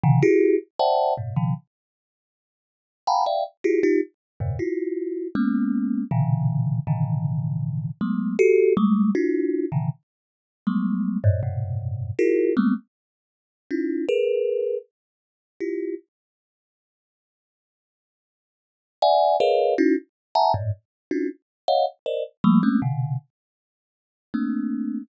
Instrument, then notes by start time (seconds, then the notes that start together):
kalimba
0.03 B2 C3 C#3 D3 E3
0.22 E4 F#4 G4 G#4
0.79 C5 D5 E5 F#5 G5 A5
1.17 G2 A2 B2
1.36 B2 C#3 D#3 F3
3.07 F5 F#5 G5 G#5 A#5 B5
3.26 D5 E5 F5 G5
3.64 E4 F4 F#4 G4 G#4
3.83 D#4 F4 G4
4.40 E2 F#2 G2 A2 B2 C#3
4.59 E4 F4 F#4
5.35 G#3 A#3 B3 C#4
6.11 A#2 B2 C#3 D3 E3
6.87 A2 B2 C#3 D3 D#3 E3
8.01 F#3 G#3 A3 B3
8.39 F#4 G4 A4
8.77 G3 G#3 A3
9.15 D4 E4 F4 F#4
9.72 A#2 C3 C#3 D3 D#3 E3
10.67 F#3 G3 G#3 A3 B3
11.24 F#2 G2 G#2 A2
11.43 F#2 G2 G#2 A2 B2 C3
12.19 E4 F4 F#4 G#4 A#4
12.57 G3 G#3 A3 A#3 B3 C4
13.71 C#4 D#4 E4 F4
14.09 G#4 A#4 B4
15.60 E4 F4 G4
19.02 D5 E5 F#5 G#5
19.40 G#4 A#4 B4 C#5 D#5 F5
19.78 C#4 D#4 E4 F#4
20.35 E5 F#5 G#5 A5 A#5
20.54 G2 G#2 A2
21.11 C#4 D4 D#4 F4 F#4
21.68 C#5 D#5 F5 F#5
22.06 A#4 C5 D5 D#5
22.44 F3 G3 A3 A#3
22.63 G#3 A3 A#3 C4 C#4
22.82 B2 C3 D3
24.34 A3 A#3 C4 D4